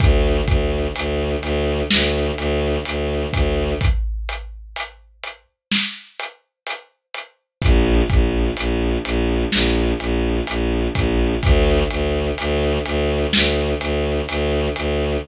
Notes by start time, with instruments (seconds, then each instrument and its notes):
0.00 violin D2, kick, closed hi-hat
0.47 violin D2, kick, closed hi-hat
0.96 violin D2, closed hi-hat
1.42 violin D2, closed hi-hat
1.90 violin D2, snare
2.38 violin D2, closed hi-hat
2.85 violin D2, closed hi-hat
3.33 violin D2, kick, closed hi-hat
3.81 kick, closed hi-hat
4.29 closed hi-hat
4.76 closed hi-hat
5.23 closed hi-hat
5.71 snare
6.19 closed hi-hat
6.67 closed hi-hat
7.14 closed hi-hat
7.62 violin A#1, kick, closed hi-hat
8.10 violin A#1, kick, closed hi-hat
8.57 violin A#1, closed hi-hat
9.05 violin A#1, closed hi-hat
9.52 violin A#1, snare
10.00 violin A#1, closed hi-hat
10.47 violin A#1, closed hi-hat
10.95 violin A#1, kick, closed hi-hat
11.43 violin D2, kick, closed hi-hat
11.90 violin D2, closed hi-hat
12.38 violin D2, closed hi-hat
12.86 violin D2, closed hi-hat
13.33 violin D2, snare
13.81 violin D2, closed hi-hat
14.28 violin D2, closed hi-hat
14.76 violin D2, closed hi-hat